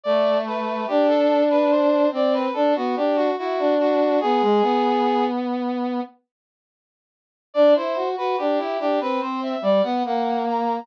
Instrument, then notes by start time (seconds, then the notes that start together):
brass section
0.03 A3 D5
0.47 B4
0.87 D4 G4
1.08 A4
1.50 B4
1.70 C5
2.11 C4 D5
2.34 B4
2.53 D4 A4
2.76 B3 F#4
2.96 D4 G4
3.16 F#4
3.38 E4 F#4
3.59 D4
3.80 F#4
4.20 B3 G#4
4.41 G#3
4.62 B3
7.54 D4 D5
7.75 E4 C5
7.95 F#4
8.16 F#4 B4
8.37 D4 G4
8.58 E4
8.79 D4 G4
9.00 C4 B4
9.21 C4 C5
9.43 E5
9.61 G3 D5
9.83 B3 F#5
10.05 A#3 F#5
10.47 A#5